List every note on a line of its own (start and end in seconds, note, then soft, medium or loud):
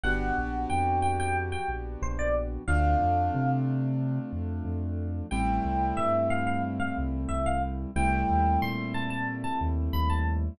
0.03 0.31 G1 loud
0.03 2.63 B3 medium
0.03 2.63 D4 medium
0.03 2.63 F#4 medium
0.03 2.63 G4 medium
0.03 0.59 F#5 medium
0.38 0.66 A#1 medium
0.70 1.55 F2 medium
0.70 0.98 G5 medium
1.02 1.18 G5 medium
1.20 1.35 G5 medium
1.52 1.68 G5 medium
1.68 1.96 A#1 medium
2.02 2.58 A#1 loud
2.02 2.18 C5 medium
2.19 2.34 D5 medium
2.67 2.95 D2 loud
2.67 5.27 A3 medium
2.67 5.27 C4 medium
2.67 5.27 D4 medium
2.67 5.27 F4 medium
2.67 3.49 F5 medium
3.01 3.29 F2 loud
3.35 4.19 C3 loud
4.32 4.60 F2 medium
4.65 5.21 F2 loud
5.31 5.60 A1 loud
5.31 7.91 G3 medium
5.31 7.91 A3 medium
5.31 7.91 C4 medium
5.31 7.91 E4 medium
5.31 5.91 G5 medium
5.64 5.92 C2 medium
5.97 6.82 G2 loud
5.97 6.27 E5 medium
6.30 6.46 F5 medium
6.47 6.62 F5 medium
6.80 6.95 F5 medium
6.98 7.26 C2 loud
7.29 7.85 C2 medium
7.29 7.44 E5 medium
7.46 7.62 F5 medium
7.96 8.24 C2 loud
7.96 10.54 G3 medium
7.96 10.54 A3 medium
7.96 10.54 C4 medium
7.96 10.54 E4 medium
7.96 8.57 G5 medium
8.29 8.57 D#2 loud
8.62 9.46 A#2 medium
8.62 8.93 C6 medium
8.94 9.10 A5 medium
9.10 9.26 A5 medium
9.44 9.59 A5 medium
9.61 9.89 D#2 loud
9.93 10.49 D#2 loud
9.93 10.09 B5 medium
10.10 10.25 A5 medium